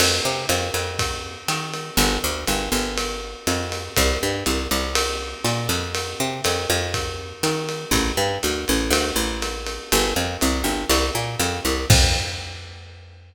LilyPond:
<<
  \new Staff \with { instrumentName = "Electric Bass (finger)" } { \clef bass \time 4/4 \key f \major \tempo 4 = 121 f,8 c8 f,8 f,4. ees4 | g,,8 d,8 g,,8 g,,4. f,4 | c,8 g,8 c,8 c,4. bes,8 f,8~ | f,8 c8 f,8 f,4. ees4 |
a,,8 g,8 d,8 a,,8 d,8 a,,4. | g,,8 f,8 c,8 g,,8 c,8 bes,8 f,8 c,8 | f,1 | }
  \new DrumStaff \with { instrumentName = "Drums" } \drummode { \time 4/4 <cymc cymr>4 <hhp cymr>8 cymr8 <bd cymr>4 <hhp cymr>8 cymr8 | cymr4 <hhp cymr>8 cymr8 cymr4 <hhp cymr>8 cymr8 | <bd cymr>4 <hhp cymr>8 cymr8 cymr4 <hhp cymr>8 cymr8 | cymr4 <hhp cymr>8 cymr8 <bd cymr>4 <hhp cymr>8 cymr8 |
<bd cymr>4 <hhp cymr>8 cymr8 cymr4 <hhp cymr>8 cymr8 | cymr4 <hhp cymr>8 cymr8 cymr4 <hhp cymr>8 cymr8 | <cymc bd>4 r4 r4 r4 | }
>>